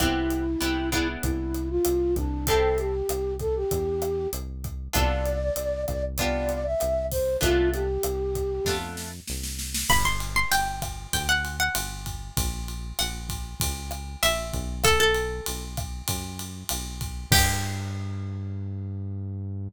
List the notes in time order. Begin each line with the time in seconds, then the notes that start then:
0.00 C2 B3 C4 E4 G4, kick, cross-stick, closed hi-hat
0.30 closed hi-hat
0.61 C2 B3 C4 E4 G4, closed hi-hat
0.92 B3 D4 E4 G#4, kick, cross-stick, closed hi-hat
1.23 C2 E4, kick, closed hi-hat
1.54 closed hi-hat
1.70 F4
1.85 C2, cross-stick, closed hi-hat
2.16 C2 D4, kick, closed hi-hat
2.47 C4 E4 G4 A4, kick, closed hi-hat
2.63 A4
2.78 G4, closed hi-hat
3.09 C2, cross-stick, closed hi-hat
3.39 A4, kick, closed hi-hat
3.56 G4
3.71 E2, kick, closed hi-hat
4.02 cross-stick, closed hi-hat
4.33 C2, closed hi-hat
4.64 kick, closed hi-hat
4.93 C2 B3 D4 F4 A4 D5, kick, cross-stick, closed hi-hat
5.26 closed hi-hat
5.56 C2, closed hi-hat
5.88 C2 D5, kick, cross-stick, closed hi-hat
6.18 B3 D4 F4 G4 D5, kick, closed hi-hat
6.49 closed hi-hat
6.65 E5
6.80 C2, cross-stick, closed hi-hat
7.11 C5, kick, open hi-hat
7.41 C2 A3 B3 D4 F4, kick, closed hi-hat
7.73 G4, closed hi-hat
8.03 C2, cross-stick, closed hi-hat
8.35 kick, closed hi-hat
8.65 F2 A3 B3 D4 F4, kick, snare
8.97 snare
9.27 C2, snare
9.43 snare
9.59 snare
9.74 snare
9.89 G1 B5, kick, cross-stick, crash
10.05 C6
10.20 ride
10.36 C6
10.51 G1 G5, ride
10.82 kick, cross-stick, ride
11.13 D2 G5, kick, ride
11.29 F#5
11.45 ride
11.60 F#5
11.75 G1, cross-stick, ride
12.06 kick, ride
12.37 A#1, kick, ride
12.68 ride
12.99 A#1 F#5, cross-stick, ride
13.29 kick, ride
13.60 C#2, kick, ride
13.91 cross-stick, ride
14.23 A#1 E5, ride
14.53 B1, kick, ride
14.84 A4, kick, cross-stick, ride
15.00 A4
15.15 ride
15.46 B1, ride
15.77 kick, cross-stick, ride
16.08 F#2, kick, ride
16.39 ride
16.69 B1, cross-stick, ride
17.01 kick, ride
17.31 G2 G4, kick, crash